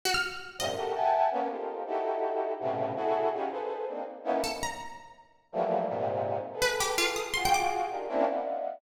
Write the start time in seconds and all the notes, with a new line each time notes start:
0.05 F#4
0.14 F6
0.58 F#2 G#2 A#2 C3 D#5
0.77 F#4 G4 A4 A#4
0.95 E5 F#5 G5 G#5 A5
1.31 A#3 B3 C#4
1.50 D#4 F4 G4 A4 A#4 C5
1.86 D#4 E4 F#4 G4 A4
2.60 A2 B2 C3 C#3
2.96 E4 F#4 G#4 A4
3.33 C#4 D#4 F4 F#4 G4 G#4
3.51 G#4 A4 B4 C5
3.87 A#3 C4 D4 D#4
4.24 A#3 B3 C#4 D#4 E4
4.44 A4
4.63 A#5
5.52 E3 F3 F#3 G3 A3 A#3
5.89 G#2 A#2 C3
6.53 G#4 A4 B4
6.62 B4
6.80 G4
6.98 F4
7.16 D#6
7.34 F4 F#4 G#4 C6
7.45 G5
7.54 D6
7.90 D4 D#4 F4 G4 G#4 A#4
8.09 A#3 C4 C#4 D4 E4
8.27 D5 D#5 E5 F5 F#5